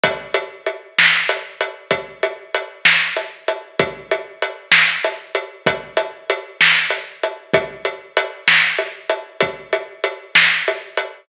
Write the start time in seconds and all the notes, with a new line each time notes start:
0.03 kick, closed hi-hat
0.34 closed hi-hat
0.66 closed hi-hat
0.98 snare
1.29 closed hi-hat
1.61 closed hi-hat
1.91 kick, closed hi-hat
2.23 closed hi-hat
2.54 closed hi-hat
2.85 snare
3.16 closed hi-hat
3.48 closed hi-hat
3.79 kick, closed hi-hat
4.11 closed hi-hat
4.42 closed hi-hat
4.71 snare
5.04 closed hi-hat
5.35 closed hi-hat
5.66 kick, closed hi-hat
5.97 closed hi-hat
6.30 closed hi-hat
6.61 snare
6.90 closed hi-hat
7.23 closed hi-hat
7.54 kick, closed hi-hat
7.85 closed hi-hat
8.17 closed hi-hat
8.48 snare
8.78 closed hi-hat
9.09 closed hi-hat
9.40 kick, closed hi-hat
9.73 closed hi-hat
10.04 closed hi-hat
10.35 snare
10.68 closed hi-hat
10.97 closed hi-hat